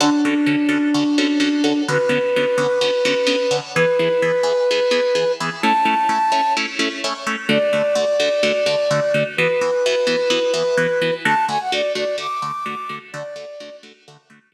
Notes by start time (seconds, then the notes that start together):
0.00 D3 C#4 D4 F#4 A4
0.25 D3 C#4 F#4 A4
0.46 D3 C#4 F#4 A4
0.69 D3 C#4 F#4 A4
0.94 D3 C#4 F#4 A4
1.18 D3 C#4 F#4 A4
1.40 D3 C#4 F#4 A4
1.64 D3 C#4 F#4 A4
1.88 D3 B3 C#4 F#4 B4
2.09 D3 B3 C#4 F#4
2.36 D3 B3 C#4 F#4
2.58 D3 B3 C#4 F#4
2.81 D3 B3 C#4 F#4
3.05 D3 B3 C#4 F#4
3.27 D3 B3 C#4 F#4
3.51 D3 B3 C#4 F#4
3.75 E3 B3 G#4 B4
3.99 E3 B3 G#4
4.22 E3 B3 G#4
4.43 E3 B3 G#4
4.71 E3 B3 G#4
4.91 E3 B3 G#4
5.15 E3 B3 G#4
5.40 E3 B3 G#4
5.62 A3 C#4 E4 A5
5.85 A3 C#4 E4
6.09 A3 C#4 E4
6.32 A3 C#4 E4
6.57 A3 C#4 E4
6.79 A3 C#4 E4
7.04 A3 C#4 E4
7.27 A3 C#4 E4
7.49 D3 A3 F#4 D5
7.73 D3 A3 F#4
7.95 D3 A3 F#4
8.20 D3 A3 F#4
8.43 D3 A3 F#4
8.66 D3 A3 F#4
8.91 D3 A3 F#4
9.14 D3 A3 F#4
9.37 E3 B3 F#4 B4
9.61 E3 B3 F#4
9.86 E3 B3 F#4
10.07 E3 B3 F#4
10.30 E3 B3 F#4
10.54 E3 B3 F#4
10.77 E3 B3 F#4
11.02 E3 B3 F#4
11.25 D3 A3 F#4 A5
11.48 D3 A3 F#4 G#5
11.60 F#5
11.72 D3 A3 F#4 D5
11.95 D3 A3 F#4 D5
12.18 D3 A3 F#4 D6
12.42 D3 A3 F#4
12.66 D3 A3 F#4
12.89 D3 A3 F#4
13.13 D3 A3 F#4 D5
13.36 D3 A3 F#4
13.60 D3 A3 F#4
13.83 D3 A3 F#4
14.08 D3 A3 F#4
14.30 D3 A3 F#4
14.52 D3 A3 F#4